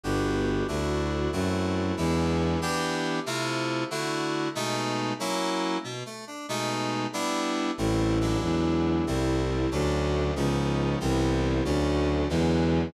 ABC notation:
X:1
M:6/8
L:1/8
Q:3/8=93
K:Ador
V:1 name="Violin" clef=bass
G,,,3 D,,3 | F,,3 E,,3 | [K:Edor] z6 | z6 |
z6 | z6 | [K:Ador] A,,,3 E,,3 | C,,3 D,,3 |
_D,,3 C,,3 | D,,3 E,,3 |]
V:2 name="Electric Piano 2"
[B,DFG]3 [A,DEF]3 | [A,CEF]3 [^G,B,DE]3 | [K:Edor] [E,B,DG]3 [=C,A,E=F]3 | [D,A,EF]3 [B,,^G,A,^D]3 |
[F,^A,CE]3 B,, =A, D | [B,,^G,A,^D]3 [=G,B,=DE]3 | [K:Ador] [G,A,CE]2 [F,^G,DE]4 | [G,A,CE]3 [F,A,^CD]3 |
[=F,_C_D_E]3 [=E,G,B,=C]3 | [D,F,A,^C]3 [D,E,F,^G,]3 |]